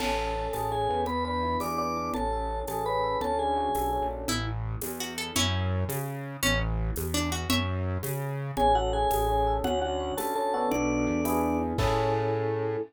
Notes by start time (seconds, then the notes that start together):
0.00 A1 C#4 A4 A5, crash, low conga
0.18 A4
0.35 C#4
0.53 A1 G#4 A4 A5, tambourine, high conga
0.72 C#4 G#4 G#5
0.89 E2 B3
1.06 B4 B5, low conga
1.25 D4 B4 B5
1.43 E4
1.60 E2 G#4 D5 D6, tambourine, high conga
1.78 B3 D5 D6
1.96 D4
2.14 A1 C#4 A4 A5, low conga
2.33 A4
2.50 C#4
2.67 A1 G#4 A4 A5, tambourine, high conga
2.86 C#4 B4 B5
3.03 A4
3.21 D2 C#4 A4 A5, low conga
3.39 D4 G#4 G#5
3.57 F#4
3.75 B1 A4, tambourine, high conga
3.93 C#4
4.02 A#1
4.11 D4
4.28 A1 E4, low conga
4.81 E2, tambourine, high conga
5.00 F#4
5.18 A4
5.36 F#2 C#4 E4, low conga
5.89 C#3, tambourine, high conga
6.43 A1 C#4, low conga
6.96 E2, tambourine, high conga
7.14 D4
7.32 F#4
7.50 F#2 C#5 E5, low conga
8.03 C#3, tambourine, high conga
8.57 A1 C#4 G#4 G#5, low conga
8.75 F#4 A4 F#5
8.93 C#4 G#4 G#5
9.11 A1 G#4, tambourine, high conga
9.29 C#4
9.47 A4
9.64 D2 C#4 F#4 F#5, low conga
9.82 D4 F#4 F#5
10.00 F#4
10.17 D2 A4 A5, tambourine, high conga
10.35 C#4 A4 A5
10.54 B3 D4 F#4 A4
10.71 B1 D4 D5, low conga
11.07 E2
11.25 B3 D4 E4 G#4, tambourine, high conga
11.78 A2 C#4 E4 G#4 A4, kick, crash